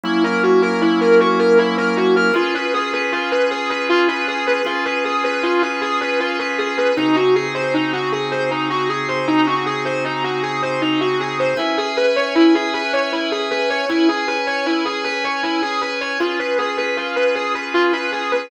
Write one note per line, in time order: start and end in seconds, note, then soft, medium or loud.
0.03 2.32 F#3 loud
0.03 2.32 A#3 loud
0.03 2.32 C#4 medium
0.03 2.32 E4 loud
0.03 0.22 E4 medium
0.24 0.41 A#4 medium
0.43 0.61 F#4 medium
0.62 0.80 A#4 medium
0.81 0.99 E4 medium
1.01 1.18 A#4 medium
1.20 1.38 F#4 medium
1.39 1.57 A#4 medium
1.58 1.76 E4 medium
1.77 1.95 A#4 medium
1.97 2.14 F#4 medium
2.16 2.34 A#4 medium
2.34 4.62 C#4 medium
2.34 4.62 F4 medium
2.34 2.53 F4 medium
2.34 4.62 G#4 loud
2.34 4.62 B4 loud
2.54 2.72 B4 medium
2.74 2.91 G#4 medium
2.93 3.10 B4 medium
3.12 3.30 F4 medium
3.31 3.49 B4 medium
3.51 3.68 G#4 medium
3.70 3.87 B4 medium
3.89 4.07 F4 medium
4.08 4.26 B4 medium
4.27 4.45 G#4 medium
4.47 4.64 B4 medium
4.65 6.93 C#4 loud
4.65 6.93 F4 medium
4.65 4.84 F4 medium
4.65 6.93 G#4 loud
4.65 6.93 B4 medium
4.85 5.03 B4 medium
5.04 5.22 G#4 medium
5.24 5.41 B4 medium
5.43 5.61 F4 medium
5.62 5.80 B4 medium
5.81 5.99 G#4 medium
6.01 6.18 B4 medium
6.20 6.37 F4 medium
6.39 6.57 B4 medium
6.58 6.76 G#4 medium
6.77 6.95 B4 medium
6.97 11.54 C#3 medium
6.97 11.54 C4 medium
6.97 7.14 D#4 medium
6.97 11.54 D#4 medium
6.97 11.54 F#4 medium
6.97 11.54 G#4 medium
7.16 7.34 F#4 medium
7.35 7.53 G#4 medium
7.54 7.72 C5 medium
7.74 7.91 D#4 medium
7.93 8.10 F#4 medium
8.12 8.30 G#4 medium
8.31 8.49 C5 medium
8.51 8.68 D#4 medium
8.70 8.88 F#4 medium
8.89 9.07 G#4 medium
9.08 9.26 C5 medium
9.27 9.45 D#4 medium
9.47 9.64 F#4 medium
9.66 9.84 G#4 medium
9.85 10.03 C5 medium
10.04 10.22 D#4 medium
10.24 10.41 F#4 medium
10.43 10.60 G#4 medium
10.62 10.80 C5 medium
10.81 10.99 D#4 medium
11.01 11.18 F#4 medium
11.20 11.37 G#4 medium
11.39 11.57 C5 medium
11.57 13.85 C#4 medium
11.57 11.76 E4 medium
11.57 13.85 B4 medium
11.57 13.85 E5 medium
11.57 13.85 G#5 medium
11.77 11.95 G#4 medium
11.97 12.14 B4 medium
12.16 12.34 C#5 medium
12.35 12.53 E4 medium
12.55 12.72 G#4 medium
12.74 12.91 B4 medium
12.93 13.10 C#5 medium
13.12 13.30 E4 medium
13.31 13.49 G#4 medium
13.51 13.68 B4 medium
13.70 13.87 C#5 medium
13.89 16.18 C#4 medium
13.89 14.07 E4 medium
13.89 16.18 B4 medium
13.89 16.18 C#5 medium
13.89 16.18 G#5 medium
14.08 14.26 G#4 medium
14.27 14.45 B4 medium
14.47 14.64 C#5 medium
14.66 14.84 E4 medium
14.85 15.03 G#4 medium
15.04 15.22 B4 medium
15.24 15.42 C#5 medium
15.43 15.61 E4 medium
15.62 15.80 G#4 medium
15.81 15.99 B4 medium
16.01 16.18 C#5 medium
16.20 18.49 C#4 medium
16.20 16.37 F4 medium
16.20 18.49 F4 medium
16.20 18.49 G#4 medium
16.20 18.49 B4 medium
16.39 16.57 B4 medium
16.58 16.76 G#4 medium
16.77 16.95 B4 medium
16.97 17.14 F4 medium
17.16 17.34 B4 medium
17.35 17.53 G#4 medium
17.54 17.72 B4 medium
17.74 17.91 F4 medium
17.93 18.10 B4 medium
18.12 18.30 G#4 medium
18.31 18.49 B4 medium